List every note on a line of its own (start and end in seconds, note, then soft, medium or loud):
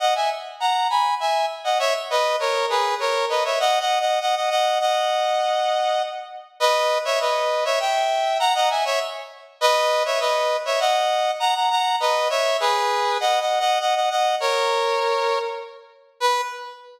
0.00 0.14 D#5 medium
0.00 0.14 F#5 medium
0.15 0.30 E5 medium
0.15 0.30 G#5 medium
0.60 0.88 F#5 medium
0.60 0.88 A#5 medium
0.90 1.14 G#5 medium
0.90 1.14 B5 medium
1.20 1.46 E5 medium
1.20 1.46 G#5 medium
1.64 1.78 D#5 medium
1.64 1.78 F#5 medium
1.79 1.93 C#5 medium
1.79 1.93 E5 loud
2.10 2.36 B4 medium
2.10 2.36 D#5 medium
2.40 2.66 A#4 medium
2.40 2.66 C#5 medium
2.70 2.95 G#4 medium
2.70 2.95 B4 medium
3.00 3.25 A#4 medium
3.00 3.25 C#5 medium
3.29 3.44 B4 medium
3.29 3.44 D#5 medium
3.45 3.59 C#5 medium
3.45 3.59 E5 medium
3.60 3.79 D#5 medium
3.60 3.79 F#5 loud
3.80 3.99 D#5 medium
3.80 3.99 F#5 medium
4.00 4.19 D#5 medium
4.00 4.19 F#5 medium
4.21 4.35 D#5 medium
4.21 4.35 F#5 medium
4.35 4.50 D#5 medium
4.35 4.50 F#5 medium
4.50 4.79 D#5 medium
4.50 4.79 F#5 medium
4.80 6.02 D#5 medium
4.80 6.02 F#5 medium
6.60 6.98 B4 medium
6.60 6.98 D#5 loud
7.05 7.19 C#5 medium
7.05 7.19 E5 medium
7.20 7.64 B4 medium
7.20 7.64 D#5 medium
7.65 7.79 C#5 medium
7.65 7.79 E5 medium
7.80 8.38 E5 medium
7.80 8.38 G5 medium
8.39 8.54 F#5 loud
8.39 8.54 A#5 loud
8.55 8.69 D#5 medium
8.55 8.69 F#5 loud
8.70 8.84 E5 medium
8.70 8.84 G#5 medium
8.85 8.99 C#5 medium
8.85 8.99 E5 loud
9.61 10.03 B4 loud
9.61 10.03 D#5 loud
10.05 10.20 C#5 medium
10.05 10.20 E5 medium
10.20 10.57 B4 medium
10.20 10.57 D#5 medium
10.65 10.79 C#5 medium
10.65 10.79 E5 medium
10.80 11.31 D#5 medium
10.80 11.31 F#5 loud
11.40 11.54 F#5 medium
11.40 11.54 A#5 loud
11.55 11.69 F#5 medium
11.55 11.69 A#5 medium
11.70 11.96 F#5 medium
11.70 11.96 A#5 loud
12.00 12.28 B4 medium
12.00 12.28 D#5 medium
12.30 12.57 C#5 medium
12.30 12.57 E5 loud
12.60 13.18 G#4 medium
12.60 13.18 B4 loud
13.20 13.39 D#5 medium
13.20 13.39 F#5 loud
13.40 13.59 D#5 medium
13.40 13.59 F#5 medium
13.60 13.79 D#5 medium
13.60 13.79 F#5 medium
13.80 13.95 D#5 medium
13.80 13.95 F#5 medium
13.95 14.09 D#5 medium
13.95 14.09 F#5 medium
14.10 14.35 D#5 medium
14.10 14.35 F#5 medium
14.40 15.38 A#4 medium
14.40 15.38 C#5 medium
16.20 16.41 B4 loud